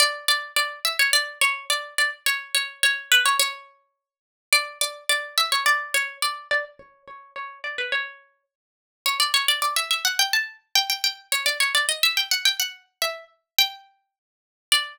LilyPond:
\new Staff { \time 2/2 \key b \minor \tempo 2 = 106 d''4 d''4 d''4 e''8 cis''8 | d''4 cis''4 d''4 d''8 r8 | cis''4 cis''4 cis''4 b'8 cis''8 | cis''2.~ cis''8 r8 |
d''4 d''4 d''4 e''8 cis''8 | d''4 cis''4 d''4 d''8 r8 | cis''4 cis''4 cis''4 d''8 b'8 | cis''2 r2 |
\key d \major cis''8 d''8 cis''8 d''8 d''8 e''8 e''8 fis''8 | g''8 a''4 r8 g''8 g''8 g''4 | cis''8 d''8 cis''8 d''8 dis''8 e''8 g''8 fis''8 | g''8 fis''4 r8 e''4 r4 |
g''2~ g''8 r4. | d''1 | }